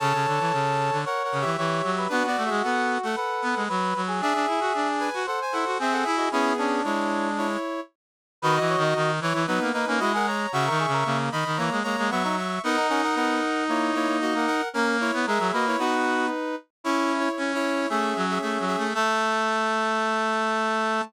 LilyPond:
<<
  \new Staff \with { instrumentName = "Brass Section" } { \time 4/4 \key a \major \tempo 4 = 114 <cis'' a''>2 \tuplet 3/2 { <ais' fis''>8 <ais' fis''>8 <g' e''>8 } <g' e''>4 | \tuplet 3/2 { <d' b'>8 <fis' d''>8 <gis' e''>8 } <a' fis''>8. <a' fis''>16 <a' fis''>4 r4 | <gis' e''>4. <b' gis''>8 <a' fis''>16 <bis' gis''>16 <a' fis''>8 <gis' e''>16 <a' fis''>16 <gis' e''>16 <fis' dis''>16 | <b gis'>4 <e' cis''>4 <e' cis''>4 r4 |
\key b \major <fis' dis''>4. <e' cis''>8 <dis' b'>8 <dis' b'>8 <fis' dis''>16 <ais' fis''>16 <cis'' ais''>8 | <e'' cis'''>4. <dis'' b''>8 <cis'' ais''>8 <cis'' ais''>8 <e'' cis'''>16 <e'' cis'''>16 <e'' cis'''>8 | <ais' fis''>8 <ais' fis''>16 <ais' fis''>16 <ais' fis''>4 <e' cis''>8 <e' cis''>8 <fis' dis''>16 <ais' fis''>16 <ais' fis''>8 | <cis' ais'>8 <e' cis''>8 <gis' e''>8 <fis' dis''>16 <e' cis''>16 <dis' b'>4. r8 |
\key a \major \tuplet 3/2 { <e' cis''>4 <e' cis''>4 <e' cis''>4 } <gis' e''>8. <gis' e''>16 <gis' e''>8 <gis' e''>8 | a''1 | }
  \new Staff \with { instrumentName = "Brass Section" } { \time 4/4 \key a \major a'2 cis''4 cis''8. b'16 | fis'2 b'4 b'8. gis'16 | gis'2 bis'4 gis'8. gis'16 | e'8 d'2 r4. |
\key b \major b'16 dis''16 cis''16 dis''16 dis'8 r8 b8 dis'16 cis'16 e'16 gis'16 r8 | fis'16 ais'16 gis'16 ais'16 ais8 r8 ais8 ais16 ais16 b16 dis'16 r8 | b16 dis'16 cis'16 dis'16 b8 r8 ais8 ais16 ais16 ais16 ais16 r8 | ais'16 r8. ais'8 b'8 b4 r4 |
\key a \major e'4 r4 cis'2 | a1 | }
  \new Staff \with { instrumentName = "Brass Section" } { \time 4/4 \key a \major cis16 cis16 d16 e16 cis8. d16 r8 cis16 e16 e8 fis8 | b16 b16 a16 gis16 b8. a16 r8 b16 gis16 fis8 fis8 | d'16 d'16 e'16 fis'16 d'8. fis'16 r8 e'16 fis'16 bis8 e'8 | cis'8 cis'8 gis4. r4. |
\key b \major \tuplet 3/2 { dis8 e8 dis8 } dis8 e16 e16 fis16 ais16 ais16 ais16 gis4 | \tuplet 3/2 { cis8 dis8 cis8 } cis8 dis16 dis16 e16 gis16 gis16 gis16 fis4 | dis'1 | ais8. b16 gis16 fis16 ais8 fis'4 r4 |
\key a \major cis'4 cis'4 a8 fis8 \tuplet 3/2 { a8 fis8 a8 } | a1 | }
>>